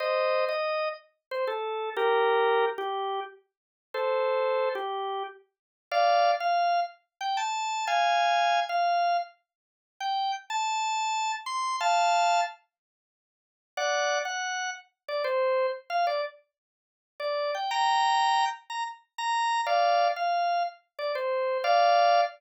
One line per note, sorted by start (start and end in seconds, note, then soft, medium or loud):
0.00 0.45 C5 medium
0.00 0.45 D#5 loud
0.49 0.89 D#5 loud
1.31 1.45 C5 loud
1.47 1.90 A4 loud
1.97 2.65 G4 loud
1.97 2.65 A#4 loud
2.78 3.20 G4 loud
3.94 4.69 A4 medium
3.94 4.69 C5 loud
4.75 5.23 G4 loud
5.91 6.31 D5 loud
5.91 6.31 F5 loud
6.40 6.80 F5 loud
7.21 7.37 G5 loud
7.37 7.85 A5 loud
7.87 8.60 F5 loud
7.87 8.60 G#5 loud
8.69 9.17 F5 loud
10.00 10.32 G5 loud
10.50 11.32 A5 loud
11.46 11.76 C6 loud
11.81 12.41 F5 loud
11.81 12.41 A5 loud
13.77 14.19 D5 loud
13.77 14.19 F#5 loud
14.25 14.70 F#5 loud
15.08 15.22 D5 loud
15.24 15.67 C5 loud
15.90 16.06 F5 loud
16.07 16.21 D5 loud
17.20 17.51 D5 loud
17.55 17.70 G5 medium
17.71 18.45 G5 loud
17.71 18.45 A#5 loud
18.70 18.84 A#5 medium
19.18 19.61 A#5 loud
19.66 20.08 D5 loud
19.66 20.08 F5 loud
20.16 20.63 F5 loud
20.99 21.12 D5 loud
21.15 21.58 C5 loud
21.64 22.21 D5 loud
21.64 22.21 F5 loud